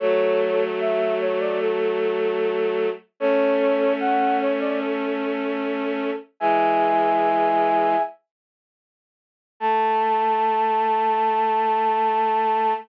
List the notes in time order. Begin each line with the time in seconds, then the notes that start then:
0.00 F#3 A3 A4 C#5
0.80 E5
1.20 C#5
1.40 D5
1.60 A4
3.20 A3 C#4 A4 C#5
4.00 F#5
4.40 C#5
4.60 D5
4.80 A4
6.40 E3 G#3 E5 G#5
9.60 A3 A5